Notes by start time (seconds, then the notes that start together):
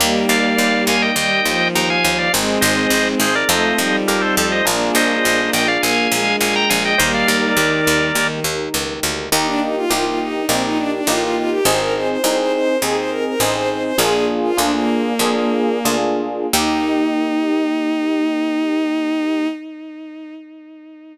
0.00 D#2 G3 A#3 D#4 G4
0.29 D#2 D5 F5
0.58 D#2
0.87 D#2 F5 G#5
1.02 D#5 G5
1.16 D#2 G3 D#5 G5
1.46 D#2 F3
1.75 D#2 G5 A#5
1.90 F5 G#5
2.04 D#2 F5 G#5
2.18 D5 F5
2.33 G#1 G#3 C4 D#4 G#4
2.61 G#1 C5 D#5
2.90 G#1
3.20 G#1 G#4 C5
3.35 A#4 D5
3.49 F2 A3 C4 D#4 F4 A4 C5 D#5
3.78 F2 G3
4.08 F2 G4 A#4
4.21 A4 C5
4.37 F2 A4 C5
4.52 C5 D#5
4.65 A#1 A#3 D4 F4 G#4 A#4
4.95 A#1 C5 D#5
5.25 A#1
5.53 A#1 D#5 G5
5.68 D5 F5
5.82 A#1 A#3 F5 G#5
6.12 A#1 G#3
6.41 A#1 F5 G#5
6.55 G5 A#5
6.70 A#1 F5 G#5
6.85 D#5 G5
6.98 D#2 G3 A#3 D#4 G4 A#4 C5 D#5
7.14 D5 F5
7.28 D#2 A#4 D5
7.57 D#2 D#3
7.87 D#2
8.15 D#2 D#3
8.44 D#2
8.74 C#2
9.03 D2
9.32 D#2 A#3 D#4 G4
9.46 D4
9.62 D#4
9.76 F4
9.90 C2 A#3 D#4 F4 G4
10.05 F4
10.19 D#4
10.48 A#1 A#3 C4 D#4 G4
10.63 D#4
10.77 D4
10.92 D4
11.07 A1 A#3 D#4 F4 G4
11.21 F4
11.36 F4
11.50 G4
11.65 G#1 C4 D#4 G#4 C5
11.79 A#4
11.95 C5
12.08 C5
12.23 C2 C4 D#4 G#4 C5
12.38 C5
12.53 C5
12.82 D#2 C4 D#4 G#4
12.96 C5
13.10 A#4
13.25 A#4
13.39 A1 C4 D#4 G#4 C5
13.54 C5
13.69 C5
13.83 C5
13.98 A#1 A#3 D4 F4 G#4
14.43 F4
14.57 D2 A#3 D4 F4 G#4
14.74 A#3
15.19 F2 A#3 D4 F4 G#4
15.85 D2 A#3 D4 F4 G#4
16.53 D#2 A#3 D#4 G4